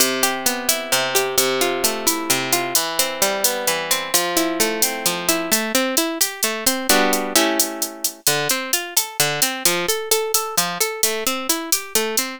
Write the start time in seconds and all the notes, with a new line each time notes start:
0.00 C3, closed hi-hat
0.23 G4, closed hi-hat
0.46 B3, closed hi-hat
0.69 E4, closed hi-hat
0.92 C3, closed hi-hat
1.15 G4, closed hi-hat
1.38 C3, closed hi-hat
1.61 F4, closed hi-hat
1.84 A3, closed hi-hat
2.07 E4, closed hi-hat
2.30 C3, closed hi-hat
2.53 F4, closed hi-hat
2.75 E3, closed hi-hat
2.99 C4, closed hi-hat
3.22 G3, closed hi-hat
3.44 B3, closed hi-hat
3.67 E3, closed hi-hat
3.91 C4, closed hi-hat
4.14 F3, closed hi-hat
4.37 E4, closed hi-hat
4.60 A3, closed hi-hat
4.82 C4, closed hi-hat
5.06 F3, closed hi-hat
5.29 E4, closed hi-hat
5.52 A3, closed hi-hat
5.75 C4, closed hi-hat
5.97 E4, closed hi-hat
6.21 G4, closed hi-hat
6.43 A3, closed hi-hat
6.66 C4, closed hi-hat
6.89 G3 B3 D4 F#4, closed hi-hat
7.13 closed hi-hat
7.36 A3 C#4 E4 G4, closed hi-hat
7.60 closed hi-hat
7.82 closed hi-hat
8.04 closed hi-hat
8.27 D3, closed hi-hat
8.49 C4, closed hi-hat
8.73 F4, closed hi-hat
8.97 A4, closed hi-hat
9.20 D3, closed hi-hat
9.42 C4, closed hi-hat
9.65 F3, closed hi-hat
9.89 A4, closed hi-hat
10.11 A4, closed hi-hat
10.34 A4, closed hi-hat
10.57 F3, closed hi-hat
10.80 A4, closed hi-hat
11.03 A3, closed hi-hat
11.27 C4, closed hi-hat
11.49 E4, closed hi-hat
11.72 G4, closed hi-hat
11.95 A3, closed hi-hat
12.17 C4, closed hi-hat